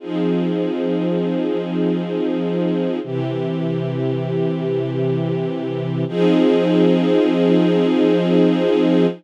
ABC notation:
X:1
M:4/4
L:1/8
Q:1/4=79
K:Fdor
V:1 name="String Ensemble 1"
[F,CEA]8 | [C,=E,G]8 | [F,CEA]8 |]